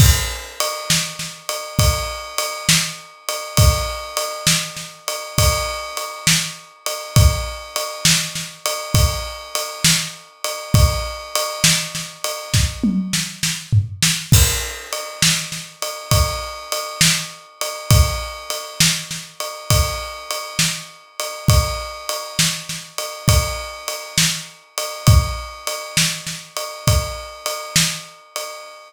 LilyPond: \new DrumStaff \drummode { \time 4/4 \tempo 4 = 67 \tuplet 3/2 { <cymc bd>8 r8 cymr8 sn8 sn8 cymr8 <bd cymr>8 r8 cymr8 sn8 r8 cymr8 } | \tuplet 3/2 { <bd cymr>8 r8 cymr8 sn8 sn8 cymr8 <bd cymr>8 r8 cymr8 sn8 r8 cymr8 } | \tuplet 3/2 { <bd cymr>8 r8 cymr8 sn8 sn8 cymr8 <bd cymr>8 r8 cymr8 sn8 r8 cymr8 } | \tuplet 3/2 { <bd cymr>8 r8 cymr8 sn8 sn8 cymr8 <bd sn>8 tommh8 sn8 sn8 tomfh8 sn8 } |
\tuplet 3/2 { <cymc bd>8 r8 cymr8 sn8 sn8 cymr8 <bd cymr>8 r8 cymr8 sn8 r8 cymr8 } | \tuplet 3/2 { <bd cymr>8 r8 cymr8 sn8 sn8 cymr8 <bd cymr>8 r8 cymr8 sn8 r8 cymr8 } | \tuplet 3/2 { <bd cymr>8 r8 cymr8 sn8 sn8 cymr8 <bd cymr>8 r8 cymr8 sn8 r8 cymr8 } | \tuplet 3/2 { <bd cymr>8 r8 cymr8 sn8 sn8 cymr8 <bd cymr>8 r8 cymr8 sn8 r8 cymr8 } | }